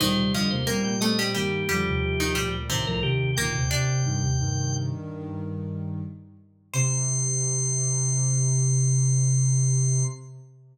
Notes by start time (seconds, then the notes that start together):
0.00 D2 A#2 D#3 G3 D#4 C5
0.16 D#2 C3 G3 C5
0.33 F2 D3 F3 G3 F4 D#5
0.50 D#2 C3 A#3 C5
0.67 A#2 G3 A#3 C4 A#4 G5
0.84 A#3 G5
1.01 A3 C4 A4 D#5
1.19 G3 C4 G4
1.35 G2 D#3 G3 A#3 G4
1.69 F2 D3 F3 G3 G4
1.85 D#2 C3
2.03 D#2 C3
2.20 D#3 D#4
2.35 D2 A#2 G3 G4
2.70 C2 A2 C3 D#3 C4 C5
2.86 C2 A2 F3 A#4
3.03 D#2 C3 D#3 G4
3.37 D2 A#2 D#3 A#3 A#4 G5
3.54 D#2 C3
3.69 D#2 C3 D4 D5
4.04 G2 D#3
4.21 D#2 C3
4.38 G2 D#3
6.74 C3 C5 C6